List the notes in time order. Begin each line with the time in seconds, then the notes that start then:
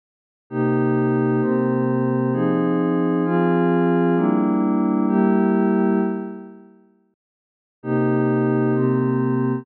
0.50 C3 A#3 D#4 G4
1.41 C3 A#3 C4 G4
2.33 F3 C4 D#4 G#4
3.25 F3 C4 F4 G#4
4.16 G3 A#3 D4 E4
5.08 G3 A#3 E4 G4
7.83 C3 A#3 D#4 G4
8.74 C3 A#3 C4 G4